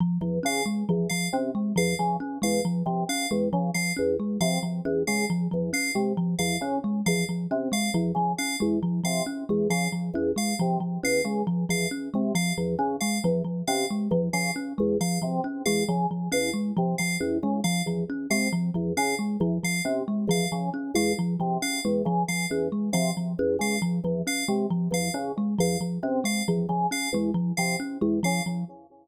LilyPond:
<<
  \new Staff \with { instrumentName = "Drawbar Organ" } { \clef bass \time 5/4 \tempo 4 = 136 r8 e,8 cis8 r8 e,8 r8 c8 r8 e,8 cis8 | r8 e,8 r8 c8 r8 e,8 cis8 r8 e,8 r8 | c8 r8 e,8 cis8 r8 e,8 r8 c8 r8 e,8 | cis8 r8 e,8 r8 c8 r8 e,8 cis8 r8 e,8 |
r8 c8 r8 e,8 cis8 r8 e,8 r8 c8 r8 | e,8 cis8 r8 e,8 r8 c8 r8 e,8 cis8 r8 | e,8 r8 c8 r8 e,8 cis8 r8 e,8 r8 c8 | r8 e,8 cis8 r8 e,8 r8 c8 r8 e,8 cis8 |
r8 e,8 r8 c8 r8 e,8 cis8 r8 e,8 r8 | c8 r8 e,8 cis8 r8 e,8 r8 c8 r8 e,8 | cis8 r8 e,8 r8 c8 r8 e,8 cis8 r8 e,8 | r8 c8 r8 e,8 cis8 r8 e,8 r8 c8 r8 |
e,8 cis8 r8 e,8 r8 c8 r8 e,8 cis8 r8 | }
  \new Staff \with { instrumentName = "Kalimba" } { \time 5/4 f8 f8 cis'8 gis8 f8 f8 cis'8 gis8 f8 f8 | cis'8 gis8 f8 f8 cis'8 gis8 f8 f8 cis'8 gis8 | f8 f8 cis'8 gis8 f8 f8 cis'8 gis8 f8 f8 | cis'8 gis8 f8 f8 cis'8 gis8 f8 f8 cis'8 gis8 |
f8 f8 cis'8 gis8 f8 f8 cis'8 gis8 f8 f8 | cis'8 gis8 f8 f8 cis'8 gis8 f8 f8 cis'8 gis8 | f8 f8 cis'8 gis8 f8 f8 cis'8 gis8 f8 f8 | cis'8 gis8 f8 f8 cis'8 gis8 f8 f8 cis'8 gis8 |
f8 f8 cis'8 gis8 f8 f8 cis'8 gis8 f8 f8 | cis'8 gis8 f8 f8 cis'8 gis8 f8 f8 cis'8 gis8 | f8 f8 cis'8 gis8 f8 f8 cis'8 gis8 f8 f8 | cis'8 gis8 f8 f8 cis'8 gis8 f8 f8 cis'8 gis8 |
f8 f8 cis'8 gis8 f8 f8 cis'8 gis8 f8 f8 | }
  \new Staff \with { instrumentName = "Electric Piano 2" } { \time 5/4 r4 f''8 r4 f''8 r4 f''8 r8 | r8 f''8 r4 f''8 r4 f''8 r4 | f''8 r4 f''8 r4 f''8 r4 f''8 | r4 f''8 r4 f''8 r4 f''8 r8 |
r8 f''8 r4 f''8 r4 f''8 r4 | f''8 r4 f''8 r4 f''8 r4 f''8 | r4 f''8 r4 f''8 r4 f''8 r8 | r8 f''8 r4 f''8 r4 f''8 r4 |
f''8 r4 f''8 r4 f''8 r4 f''8 | r4 f''8 r4 f''8 r4 f''8 r8 | r8 f''8 r4 f''8 r4 f''8 r4 | f''8 r4 f''8 r4 f''8 r4 f''8 |
r4 f''8 r4 f''8 r4 f''8 r8 | }
>>